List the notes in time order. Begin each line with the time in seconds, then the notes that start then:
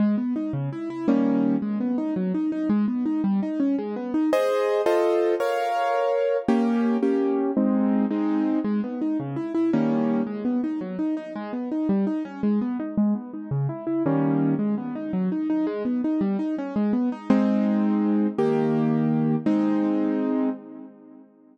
0.00 G#3
0.18 B3
0.36 D#4
0.53 C#3
0.73 E4
0.90 E4
1.08 D#3 G3 A#3 C#4
1.62 G#3
1.80 B3
1.98 D#4
2.16 F#3
2.34 D#4
2.52 D#4
2.70 G#3
2.88 B3
3.06 D#4
3.24 G3
3.43 D#4
3.60 C#4
3.79 G#3
3.96 B3
4.14 D#4
4.33 G#4 C5 D#5
4.86 F4 A4 C5 D#5
5.40 A#4 C#5 F5
6.48 A#3 C#4 G4
7.03 A#3 C#4 G4
7.57 G#3 C4 D#4
8.11 G#3 C4 D#4
8.64 G#3
8.84 B3
9.02 D#4
9.20 C#3
9.36 E4
9.55 E4
9.73 D#3 G3 A#3 C#4
10.27 G#3
10.45 B3
10.64 D#4
10.81 F#3
10.99 D#4
11.17 D#4
11.36 G#3
11.53 B3
11.72 D#4
11.89 G3
12.07 D#4
12.25 C#4
12.43 G#3
12.61 B3
12.80 D#4
12.97 G#3
13.15 B3
13.33 D#4
13.51 C#3
13.69 E4
13.87 E4
14.06 D#3 G3 A#3 C#4
14.59 G#3
14.78 B3
14.95 D#4
15.13 F#3
15.32 D#4
15.50 D#4
15.67 G#3
15.85 B3
16.04 D#4
16.21 G3
16.39 D#4
16.58 C#4
16.76 G#3
16.93 B3
17.12 D#4
17.30 G#3 C4 D#4
18.38 D#3 A#3 G4
19.46 G#3 C4 D#4